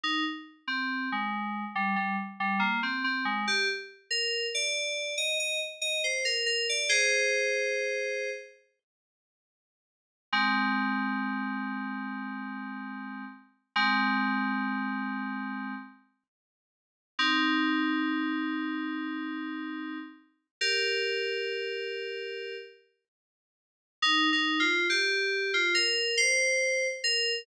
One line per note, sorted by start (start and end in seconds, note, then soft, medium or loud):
0.03 0.24 D#4 loud
0.68 1.09 C4 medium
1.12 1.64 G#3 medium
1.75 1.96 G3 medium
1.96 2.16 G3 medium
2.40 2.60 G3 medium
2.59 2.80 A#3 medium
2.83 3.03 C4 medium
3.04 3.24 C4 medium
3.25 3.45 G#3 medium
3.48 3.68 G4 loud
4.11 4.46 A#4 medium
4.54 5.14 D5 medium
5.18 5.38 D#5 medium
5.39 5.60 D#5 medium
5.81 6.02 D#5 medium
6.04 6.24 C5 medium
6.25 6.45 A#4 medium
6.46 6.66 A#4 medium
6.69 6.90 D5 medium
6.89 8.30 G#4 medium
6.89 8.30 C5 loud
10.33 13.24 G#3 medium
10.33 13.24 C4 loud
13.76 15.74 G#3 loud
13.76 15.74 C4 loud
17.19 19.98 C4 medium
17.19 19.98 D#4 loud
20.61 22.55 G4 medium
20.61 22.55 A#4 medium
24.02 24.29 D#4 loud
24.33 24.60 D#4 loud
24.60 24.87 F4 loud
24.89 25.51 G4 loud
25.54 25.74 F4 loud
25.74 26.16 A#4 loud
26.17 26.87 C5 loud
27.04 27.39 A#4 loud